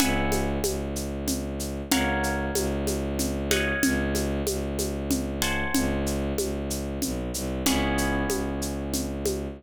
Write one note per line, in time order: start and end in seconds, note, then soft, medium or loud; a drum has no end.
0.00 0.59 C#2 loud
0.00 1.88 B4 medium
0.00 1.88 E5 medium
0.00 1.88 F#5 medium
0.00 1.88 G#5 medium
0.00 low conga loud
0.00 shaker medium
0.32 high conga medium
0.32 shaker medium
0.64 1.82 C#2 medium
0.64 high conga medium
0.64 shaker medium
0.96 shaker medium
1.28 low conga medium
1.28 shaker medium
1.60 shaker medium
1.91 2.50 C#2 loud
1.91 3.44 A#4 medium
1.91 3.44 C#5 medium
1.91 3.44 F5 medium
1.91 3.44 F#5 medium
1.91 low conga loud
1.91 shaker medium
2.23 shaker medium
2.55 3.73 C#2 loud
2.55 high conga medium
2.55 shaker medium
2.87 high conga medium
2.87 shaker medium
3.19 low conga medium
3.19 shaker medium
3.51 5.33 C#5 medium
3.51 5.33 D#5 medium
3.51 5.33 F5 medium
3.51 5.33 F#5 medium
3.51 high conga medium
3.51 shaker medium
3.83 4.42 C#2 loud
3.83 low conga loud
3.83 shaker medium
4.15 high conga medium
4.15 shaker medium
4.47 5.64 C#2 loud
4.47 high conga medium
4.47 shaker medium
4.79 high conga medium
4.79 shaker medium
5.11 low conga loud
5.11 shaker medium
5.42 7.62 C5 medium
5.42 7.62 F#5 medium
5.42 7.62 G#5 medium
5.42 7.62 A5 medium
5.42 shaker medium
5.74 6.33 C#2 loud
5.74 low conga loud
5.74 shaker medium
6.06 shaker medium
6.38 6.99 C#2 loud
6.38 high conga medium
6.38 shaker medium
6.70 shaker medium
7.02 7.31 B1 medium
7.02 low conga medium
7.02 shaker medium
7.34 7.63 C2 loud
7.34 shaker medium
7.66 8.25 C#2 loud
7.66 9.54 B3 medium
7.66 9.54 C#4 medium
7.66 9.54 E4 medium
7.66 9.54 G#4 medium
7.66 low conga loud
7.66 shaker medium
7.98 shaker medium
8.30 9.47 C#2 medium
8.30 high conga medium
8.30 shaker medium
8.62 shaker medium
8.94 low conga medium
8.94 shaker medium
9.26 high conga medium
9.26 shaker medium